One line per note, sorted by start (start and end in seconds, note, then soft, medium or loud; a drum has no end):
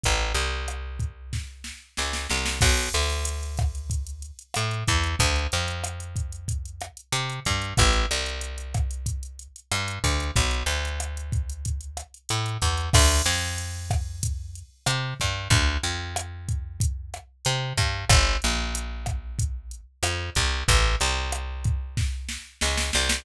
0.03 0.33 A1 medium
0.03 kick medium
0.03 closed hi-hat loud
0.34 1.72 C2 medium
0.34 closed hi-hat medium
0.68 cross-stick medium
0.68 closed hi-hat loud
0.99 kick medium
0.99 closed hi-hat medium
1.33 kick medium
1.33 snare medium
1.64 snare medium
1.97 2.27 C#2 medium
1.97 snare medium
2.13 snare medium
2.29 2.59 C2 medium
2.29 snare medium
2.46 snare loud
2.61 2.89 B1 loud
2.61 kick loud
2.61 cross-stick loud
2.61 crash loud
2.77 closed hi-hat medium
2.93 4.31 D2 medium
2.93 closed hi-hat medium
3.10 closed hi-hat medium
3.25 closed hi-hat loud
3.43 closed hi-hat medium
3.57 kick loud
3.57 cross-stick loud
3.57 closed hi-hat medium
3.75 closed hi-hat medium
3.90 kick medium
3.90 closed hi-hat loud
4.07 closed hi-hat medium
4.22 closed hi-hat medium
4.39 closed hi-hat medium
4.54 4.84 A2 medium
4.54 cross-stick loud
4.54 closed hi-hat loud
4.71 closed hi-hat medium
4.87 5.16 E2 medium
4.87 kick loud
4.87 closed hi-hat medium
5.04 closed hi-hat medium
5.19 5.47 D2 loud
5.19 kick loud
5.19 closed hi-hat loud
5.36 closed hi-hat medium
5.52 6.90 F2 medium
5.52 closed hi-hat medium
5.68 closed hi-hat medium
5.84 cross-stick loud
5.84 closed hi-hat loud
6.00 closed hi-hat medium
6.16 kick medium
6.16 closed hi-hat loud
6.32 closed hi-hat medium
6.48 kick medium
6.48 closed hi-hat loud
6.65 closed hi-hat medium
6.81 cross-stick loud
6.81 closed hi-hat medium
6.97 closed hi-hat medium
7.12 7.40 C3 medium
7.12 closed hi-hat loud
7.30 closed hi-hat medium
7.45 7.74 G2 medium
7.45 kick medium
7.45 closed hi-hat medium
7.62 closed hi-hat medium
7.77 8.06 A1 loud
7.77 kick loud
7.77 cross-stick loud
7.77 closed hi-hat loud
7.93 closed hi-hat medium
8.11 9.48 C2 medium
8.11 closed hi-hat medium
8.26 closed hi-hat medium
8.41 closed hi-hat loud
8.58 closed hi-hat medium
8.74 kick loud
8.74 cross-stick medium
8.74 closed hi-hat loud
8.91 closed hi-hat medium
9.06 kick medium
9.06 closed hi-hat loud
9.23 closed hi-hat medium
9.39 closed hi-hat medium
9.56 closed hi-hat medium
9.72 9.99 G2 medium
9.72 cross-stick medium
9.72 closed hi-hat loud
9.88 closed hi-hat loud
10.04 10.31 D2 medium
10.04 kick medium
10.04 closed hi-hat medium
10.20 closed hi-hat medium
10.36 10.63 B1 medium
10.36 kick loud
10.36 closed hi-hat loud
10.51 closed hi-hat medium
10.66 12.03 D2 medium
10.66 closed hi-hat medium
10.85 closed hi-hat medium
11.00 cross-stick medium
11.00 closed hi-hat loud
11.17 closed hi-hat medium
11.32 kick loud
11.32 closed hi-hat medium
11.50 closed hi-hat medium
11.65 kick medium
11.65 closed hi-hat loud
11.81 closed hi-hat medium
11.97 cross-stick medium
11.97 closed hi-hat loud
12.14 closed hi-hat medium
12.29 12.58 A2 medium
12.29 closed hi-hat loud
12.46 closed hi-hat medium
12.62 12.89 E2 medium
12.62 kick medium
12.62 closed hi-hat medium
12.77 closed hi-hat medium
12.93 13.22 D2 loud
12.93 kick loud
12.93 cross-stick loud
12.93 crash loud
13.26 14.63 F2 loud
13.26 closed hi-hat medium
13.58 closed hi-hat loud
13.90 kick loud
13.90 cross-stick loud
13.90 closed hi-hat medium
14.23 kick loud
14.23 closed hi-hat loud
14.55 closed hi-hat medium
14.86 15.14 C3 medium
14.86 cross-stick loud
14.86 closed hi-hat loud
15.20 15.48 G2 medium
15.20 kick medium
15.20 closed hi-hat medium
15.50 15.78 D2 loud
15.50 kick loud
15.50 closed hi-hat loud
15.83 17.20 F2 medium
15.83 closed hi-hat medium
16.16 cross-stick loud
16.16 closed hi-hat loud
16.49 kick loud
16.49 closed hi-hat medium
16.80 kick loud
16.80 closed hi-hat loud
17.14 cross-stick loud
17.14 closed hi-hat medium
17.45 17.73 C3 loud
17.45 closed hi-hat loud
17.77 18.05 G2 medium
17.77 kick loud
17.77 closed hi-hat loud
18.09 18.37 G1 loud
18.09 kick loud
18.09 cross-stick loud
18.09 closed hi-hat loud
18.42 19.81 A#1 medium
18.42 closed hi-hat medium
18.75 closed hi-hat loud
19.06 kick medium
19.06 cross-stick loud
19.06 closed hi-hat medium
19.39 kick loud
19.39 closed hi-hat loud
19.71 closed hi-hat medium
20.03 20.30 F2 medium
20.03 cross-stick loud
20.03 closed hi-hat loud
20.35 20.64 C2 loud
20.35 kick medium
20.35 closed hi-hat medium
20.68 20.96 A1 loud
20.68 kick loud
20.68 closed hi-hat loud
21.00 22.38 C2 loud
21.00 closed hi-hat medium
21.32 cross-stick loud
21.32 closed hi-hat loud
21.64 kick loud
21.64 closed hi-hat medium
21.97 kick loud
21.97 snare medium
22.29 snare medium
22.61 22.91 C#2 medium
22.61 snare loud
22.77 snare loud
22.93 23.24 C2 loud
22.93 snare loud
23.09 snare loud